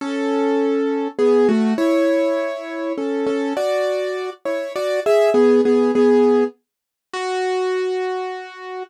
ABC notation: X:1
M:3/4
L:1/8
Q:1/4=101
K:F#m
V:1 name="Acoustic Grand Piano"
[CA]4 [B,G] [A,F] | [Ec]4 [CA] [CA] | [Fd]3 [Ec] [Fd] [Ge] | [B,G] [B,G] [B,G]2 z2 |
F6 |]